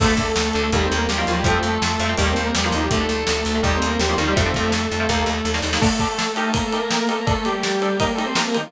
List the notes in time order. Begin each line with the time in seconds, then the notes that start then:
0.00 D2 D3 A3 A4, kick, crash
0.17 D2 A3 A4, kick, closed hi-hat
0.36 D2, snare
0.53 D2 D3 A3, closed hi-hat
0.63 D3 A3
0.72 D#2 D#3 G3 A#3 G4, kick, closed hi-hat
0.85 C4 C5
0.92 D#2, closed hi-hat
0.97 A#3 A#4
1.08 D#2 G3 G4, snare
1.17 D#3 F3 G3 A#3 F4
1.27 D#2 F3 F4, closed hi-hat
1.38 G3 G4
1.44 F2 F3 A3 C4 A4, kick, closed hi-hat
1.63 F2 A3 A4, closed hi-hat
1.82 F2, snare
1.99 F2 F3 A3 C4, closed hi-hat
2.09 F3 A3 C4
2.17 D#2 D#3 G3 A#3 G4, kick, closed hi-hat
2.31 C4 C5
2.36 D#2, closed hi-hat
2.43 A#3 A#4
2.55 E2 G3 G4, snare
2.64 D#3 F3 G3 A#3 F4
2.72 D#2 D#3 D#4, closed hi-hat
2.83 G3 G4
2.91 D2 D3 A3 A4, kick, closed hi-hat
3.00 D3 A3
3.08 D2 A3 A4, closed hi-hat
3.27 D2, snare
3.45 D2, closed hi-hat
3.55 D3 A3
3.62 D#2 D#3 G3 A#3 G4, kick
3.76 C4 C5
3.82 D#2, closed hi-hat
3.86 A#3 A#4
3.99 D#2 G3 G4, snare
4.09 D#3 F3 G3 A#3 F4
4.18 D#2 D#3 G3 A#3 D#4, closed hi-hat
4.27 D#3 G3 A#3 G4
4.36 F2 F3 A3 C4 A4, kick, closed hi-hat
4.46 F3 A3 C4
4.54 F2, kick, closed hi-hat
4.72 F2, snare
4.92 F2, closed hi-hat
5.00 F3 A3 C4
5.09 D#2 D#3 G3 A#3, kick, snare
5.26 D#2, snare
5.45 D#2, snare
5.54 D#3 G3 A#3, snare
5.62 D#2 D#3 G3 A#3, snare
5.73 D#3 G3 A#3, snare
5.81 D3 A3 D4 A4, kick, crash
5.99 D3 A3 D4 A4, kick, ride
6.18 D3 D4 A4, snare
6.36 D#4 G4 A#4, ride
6.53 A#3 A#4, kick, ride
6.66 A3 A4
6.72 D#4 G4 A#4, ride
6.79 A#3 A#4
6.91 A#3 D#4 G4 A#4, snare
7.01 A#3 A#4
7.09 A3 D#4 G4 A4 A#4, ride
7.19 A#3 A#4
7.27 A3 D4 A4 D5, kick, ride
7.45 G3 D4 G4 A4 D5, ride
7.63 D4 A4 D5, snare
7.82 D4 A4 D5, ride
7.99 A#3 D#4 G4 A#4, kick, ride
8.14 A3 A4
8.18 D#4 G4 A#4, ride
8.25 C4 C5
8.35 A#3 D#4 G4 A#4, snare
8.47 A#3 A#4
8.54 D#3 D#4 G4 A#4, ride
8.66 F3 F4